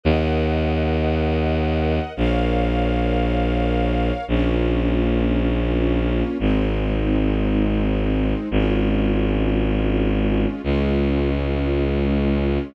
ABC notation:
X:1
M:3/4
L:1/8
Q:1/4=85
K:Bbm
V:1 name="String Ensemble 1"
[Beg]6 | [Bdf]6 | [B,DF]6 | [A,CE]6 |
[A,DF]6 | [A,DF]6 |]
V:2 name="Violin" clef=bass
E,,6 | B,,,6 | B,,,6 | A,,,6 |
A,,,6 | D,,6 |]